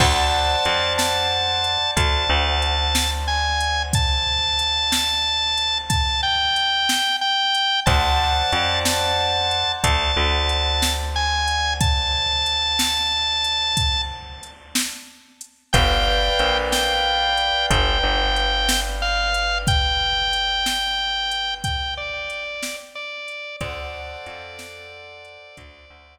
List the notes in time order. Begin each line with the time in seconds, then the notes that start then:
0.00 D2 C5 D5 F#5 A5, kick, crash
0.65 F2, closed hi-hat
0.98 A5, snare
1.64 closed hi-hat
1.96 D2 A5, kick, closed hi-hat
2.30 D2
2.62 closed hi-hat
2.95 snare
3.28 G#5
3.60 closed hi-hat
3.93 A5, kick, closed hi-hat
4.59 closed hi-hat
4.92 snare
5.57 closed hi-hat
5.90 A5, kick, closed hi-hat
6.23 G5
6.56 closed hi-hat
6.89 snare
7.21 G5
7.54 closed hi-hat
7.86 D2 C5 D5 F#5 A5, kick, closed hi-hat
8.52 F2, closed hi-hat
8.85 A5, snare
9.51 closed hi-hat
9.83 D2 A5, kick, closed hi-hat
10.17 D2
10.49 closed hi-hat
10.82 snare
11.16 G#5
11.47 closed hi-hat
11.80 A5, kick, closed hi-hat
12.46 closed hi-hat
12.79 snare
13.44 closed hi-hat
13.77 kick, closed hi-hat
14.43 closed hi-hat
14.75 snare
15.41 closed hi-hat
15.73 G1 B4 D5 F5 G5, kick, closed hi-hat
16.39 A#1, closed hi-hat
16.72 G5, snare
17.37 closed hi-hat
17.70 G1 G5, kick, closed hi-hat
18.03 G1
18.36 closed hi-hat
18.69 snare
19.02 F5
19.34 closed hi-hat
19.67 G5, kick, closed hi-hat
20.33 closed hi-hat
20.66 snare
21.31 closed hi-hat
21.64 G5, kick, closed hi-hat
21.97 D5
22.30 closed hi-hat
22.62 snare
22.95 D5
23.28 closed hi-hat
23.60 D2 A4 C5 D5 F#5, kick, closed hi-hat
24.26 F2, closed hi-hat
24.59 snare
25.24 closed hi-hat
25.57 D2, kick, closed hi-hat
25.90 D2